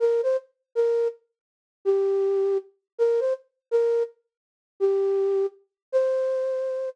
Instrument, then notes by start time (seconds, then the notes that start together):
flute
0.00 A#4
0.23 C5
0.75 A#4
1.85 G4
2.98 A#4
3.20 C5
3.71 A#4
4.80 G4
5.92 C5